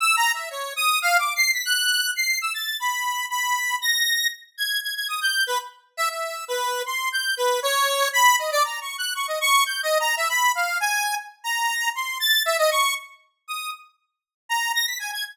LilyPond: \new Staff { \time 5/4 \tempo 4 = 118 \tuplet 3/2 { e'''8 ais''8 e''8 } cis''8 dis'''8 \tuplet 3/2 { f''8 d'''8 c''''8 } b'''16 fis'''4 c''''8 e'''16 | a'''8 b''4 b''4 ais'''4 r8 gis'''8 gis'''16 gis'''16 | dis'''16 g'''8 b'16 r8. e''16 e''8. b'8. c'''8 g'''8 b'8 | cis''4 b''8 dis''16 d''16 \tuplet 3/2 { ais''8 cis'''8 fis'''8 } cis'''16 dis''16 cis'''8 \tuplet 3/2 { g'''8 dis''8 ais''8 } |
e''16 b''8 f''8 gis''8. r8 ais''4 c'''8 a'''8 e''16 dis''16 | cis'''8 r4 dis'''8 r4. ais''8 ais'''16 b'''16 gis''16 gis'''16 | }